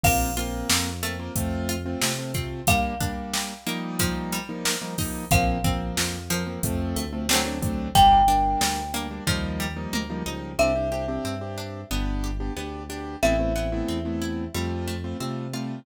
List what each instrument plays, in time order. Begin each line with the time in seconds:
0.04 synth bass 1 A#1, acoustic grand piano A#3 C4 F4, pizzicato strings A#3, marimba F5, kick, crash
0.37 acoustic grand piano A#3 C4 F4, pizzicato strings F4, closed hi-hat
0.70 synth bass 1 F2, pizzicato strings A#3, snare
1.03 pizzicato strings A3, acoustic grand piano A#3 C4 F4, closed hi-hat
1.19 acoustic grand piano A#3 C4 F4
1.36 synth bass 1 F2, acoustic grand piano A3 C4 F4, kick, closed hi-hat
1.69 pizzicato strings F4, closed hi-hat
1.86 acoustic grand piano A3 C4 F4
2.02 synth bass 1 C3, pizzicato strings A3, snare
2.18 acoustic grand piano A3 C4 F4
2.34 acoustic grand piano A3 C4 F4, pizzicato strings C4, kick, closed hi-hat
2.67 pizzicato strings G3, acoustic grand piano G3 A#3 D4, marimba F5, kick, closed hi-hat
3.00 acoustic grand piano G3 A#3 D4, pizzicato strings D4, kick, closed hi-hat
3.34 pizzicato strings G3, snare
3.67 acoustic grand piano F3 G3 A#3 D#4, pizzicato strings A#3, closed hi-hat
3.99 pizzicato strings F3, kick, closed hi-hat
4.32 pizzicato strings G3, closed hi-hat
4.49 acoustic grand piano F3 G3 A#3 D#4
4.65 pizzicato strings A#3, snare
4.82 acoustic grand piano F3 G3 A#3 D#4
4.98 acoustic grand piano F3 G3 A#3 D#4, pizzicato strings D#4, kick, open hi-hat
5.31 synth bass 1 A#1, pizzicato strings F3, acoustic grand piano F3 A#3 C4, marimba F5, kick, closed hi-hat
5.64 acoustic grand piano F3 A#3 C4, pizzicato strings C4, kick, closed hi-hat
5.97 synth bass 1 F2, pizzicato strings F3, snare
6.30 pizzicato strings F3, acoustic grand piano F3 A#3 C4, closed hi-hat
6.47 acoustic grand piano F3 A#3 C4
6.63 synth bass 1 F2, acoustic grand piano F3 A3 C4, kick, closed hi-hat
6.96 synth bass 1 D2, pizzicato strings A3, closed hi-hat
7.13 acoustic grand piano F3 A3 C4
7.29 acoustic grand piano F#3 A3 C4 D4, pizzicato strings A3 C4 D4, snare
7.34 pizzicato strings F#3
7.45 acoustic grand piano F#3 A3 C4 D4
7.62 acoustic grand piano F#3 A3 C4 D4, kick, closed hi-hat
7.95 synth bass 1 G1, pizzicato strings G3, acoustic grand piano G3 A#3 D4, marimba G5, kick, closed hi-hat
8.28 acoustic grand piano G3 A#3 D4, pizzicato strings D4, closed hi-hat
8.61 synth bass 1 D2, pizzicato strings G3, snare
8.94 acoustic grand piano G3 A#3 D4, pizzicato strings A#3, closed hi-hat
9.11 acoustic grand piano G3 A#3 D4
9.27 synth bass 1 D#2, acoustic grand piano F3 G3 A#3 D#4, pizzicato strings F3, kick
9.60 pizzicato strings G3
9.77 acoustic grand piano F3 G3 A#3 D#4
9.93 synth bass 1 D2, pizzicato strings A#3, high tom
10.10 acoustic grand piano F3 G3 A#3 D#4
10.26 synth bass 1 C#2, acoustic grand piano F3 G3 A#3 D#4, pizzicato strings D#4
10.59 synth bass 1 C2, acoustic grand piano C4 D4 G4, pizzicato strings C4, marimba E5
10.75 acoustic grand piano C4 D4 G4
10.92 acoustic grand piano C4 D4 G4, pizzicato strings G4
11.08 acoustic grand piano C4 D4 G4
11.25 synth bass 1 G2, pizzicato strings C4
11.41 acoustic grand piano C4 D4 G4
11.58 pizzicato strings D4
11.91 synth bass 1 G1, acoustic grand piano B3 D4 G4, pizzicato strings B3
12.24 pizzicato strings G4
12.40 acoustic grand piano B3 D4 G4
12.57 synth bass 1 D2, pizzicato strings B3, acoustic grand piano B3 D4 G4
12.89 acoustic grand piano B3 D4 G4, pizzicato strings D4
13.23 synth bass 1 A1, pizzicato strings A3, acoustic grand piano A3 B3 C4 E4, marimba E5
13.39 acoustic grand piano A3 B3 C4 E4
13.56 acoustic grand piano A3 B3 C4 E4, pizzicato strings B3
13.72 acoustic grand piano A3 B3 C4 E4
13.88 synth bass 1 E2, pizzicato strings C4
14.05 acoustic grand piano A3 B3 C4 E4
14.22 pizzicato strings E4
14.55 synth bass 1 F2, pizzicato strings G3, acoustic grand piano G3 A3 C4 F4
14.88 pizzicato strings A3
15.04 acoustic grand piano G3 A3 C4 F4
15.20 synth bass 1 C3, acoustic grand piano G3 A3 C4 F4, pizzicato strings C4
15.53 acoustic grand piano G3 A3 C4 F4, pizzicato strings F4